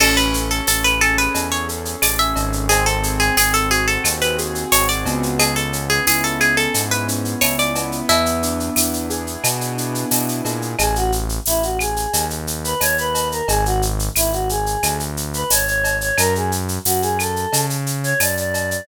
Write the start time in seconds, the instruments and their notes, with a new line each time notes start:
0.00 synth bass 1 A1, acoustic grand piano C#4, acoustic guitar (steel) A4, crash, cowbell, claves
0.17 acoustic guitar (steel) B4, shaker
0.34 acoustic grand piano A4, shaker
0.50 acoustic guitar (steel) A4, shaker
0.67 synth bass 1 A1, acoustic grand piano C#4, acoustic guitar (steel) A4, tambourine, shaker
0.84 acoustic guitar (steel) B4, shaker
1.01 acoustic grand piano G#4, acoustic guitar (steel) A4, claves, shaker
1.18 acoustic guitar (steel) B4, shaker
1.35 synth bass 1 E2, acoustic grand piano C#4, cowbell, shaker
1.52 acoustic guitar (steel) C#5, shaker
1.69 acoustic grand piano A4, shaker
1.85 shaker
2.02 synth bass 1 A1, acoustic grand piano G#4, acoustic guitar (steel) D5, tambourine, cowbell, claves, shaker
2.19 acoustic guitar (steel) E5, shaker
2.36 synth bass 1 G#1, acoustic grand piano C#4, cowbell, shaker
2.53 shaker
2.69 acoustic grand piano C4, acoustic guitar (steel) G#4, cowbell, shaker
2.86 acoustic guitar (steel) A4, shaker
3.03 acoustic grand piano G#4, shaker
3.20 acoustic guitar (steel) G#4, shaker
3.37 synth bass 1 G#1, acoustic grand piano C4, acoustic guitar (steel) G#4, tambourine, claves, shaker
3.54 acoustic guitar (steel) A4, shaker
3.71 acoustic grand piano F#4, acoustic guitar (steel) G#4, shaker
3.87 acoustic guitar (steel) A4, shaker
4.04 synth bass 1 D#2, acoustic grand piano C4, cowbell, claves, shaker
4.21 acoustic guitar (steel) B4, shaker
4.38 acoustic grand piano G#4, shaker
4.55 shaker
4.72 synth bass 1 G#1, acoustic grand piano F#4, acoustic guitar (steel) C#5, tambourine, cowbell, shaker
4.89 acoustic guitar (steel) D5, shaker
5.05 synth bass 1 C#2, acoustic grand piano B3, cowbell, shaker
5.23 shaker
5.39 acoustic guitar (steel) G#4, cowbell, claves, shaker
5.56 acoustic guitar (steel) A4, shaker
5.73 acoustic grand piano C#4, shaker
5.90 acoustic guitar (steel) G#4, shaker
6.07 synth bass 1 C#2, acoustic grand piano E4, acoustic guitar (steel) G#4, tambourine, shaker
6.24 acoustic guitar (steel) A4, shaker
6.40 acoustic grand piano G#4, acoustic guitar (steel) G#4, claves, shaker
6.57 acoustic guitar (steel) A4, shaker
6.74 synth bass 1 G#2, acoustic grand piano B3, cowbell, shaker
6.91 acoustic guitar (steel) B4, shaker
7.08 acoustic grand piano C#4, shaker
7.25 shaker
7.41 synth bass 1 C#2, acoustic grand piano E4, acoustic guitar (steel) C#5, tambourine, cowbell, claves, shaker
7.59 acoustic guitar (steel) D5, shaker
7.75 acoustic grand piano B3, cowbell, shaker
7.92 shaker
8.09 synth bass 1 E2, acoustic guitar (steel) E4, cowbell, shaker
8.26 shaker
8.43 acoustic grand piano D4, shaker
8.60 shaker
8.76 synth bass 1 E2, acoustic grand piano E4, tambourine, claves, shaker
8.93 shaker
9.10 acoustic grand piano G#4, shaker
9.27 shaker
9.44 synth bass 1 B2, acoustic grand piano B3, cowbell, claves, shaker
9.61 shaker
9.78 acoustic grand piano D4, shaker
9.95 shaker
10.11 synth bass 1 B2, acoustic grand piano E4, tambourine, cowbell, shaker
10.28 shaker
10.45 synth bass 1 A#2, acoustic grand piano G#4, cowbell, shaker
10.62 shaker
10.79 synth bass 1 A1, choir aahs G#4, cowbell, claves, shaker
10.96 choir aahs F#4, shaker
11.12 shaker
11.29 shaker
11.46 synth bass 1 A1, choir aahs E4, tambourine, shaker
11.63 choir aahs F#4, shaker
11.79 choir aahs G#4, claves, shaker
11.96 shaker
12.13 synth bass 1 D#2, cowbell, shaker
12.30 shaker
12.47 shaker
12.64 choir aahs B4, shaker
12.80 synth bass 1 D#2, choir aahs C#5, tambourine, cowbell, claves, shaker
12.98 choir aahs B4, shaker
13.15 cowbell, shaker
13.31 choir aahs A#4, shaker
13.48 synth bass 1 G#1, choir aahs G#4, cowbell, shaker
13.65 choir aahs F#4, shaker
13.82 shaker
13.99 shaker
14.16 synth bass 1 G#1, choir aahs E4, tambourine, claves, shaker
14.33 choir aahs F#4, shaker
14.49 choir aahs G#4, shaker
14.66 shaker
14.83 synth bass 1 D2, cowbell, claves, shaker
15.00 shaker
15.17 shaker
15.34 choir aahs B4, shaker
15.50 synth bass 1 G#1, choir aahs C#5, tambourine, cowbell, shaker
15.67 choir aahs C#5, shaker
15.84 cowbell, shaker
16.01 choir aahs C#5, shaker
16.17 synth bass 1 F#2, choir aahs A#4, cowbell, claves, shaker
16.35 choir aahs G#4, shaker
16.52 shaker
16.68 shaker
16.85 synth bass 1 F#2, choir aahs F#4, tambourine, shaker
17.02 choir aahs G#4, shaker
17.19 choir aahs A4, claves, shaker
17.36 shaker
17.53 synth bass 1 C#3, cowbell, shaker
17.70 shaker
17.86 shaker
18.03 choir aahs C#5, shaker
18.20 synth bass 1 F#2, choir aahs D5, tambourine, cowbell, claves, shaker
18.37 choir aahs D5, shaker
18.54 cowbell, shaker
18.71 choir aahs D5, shaker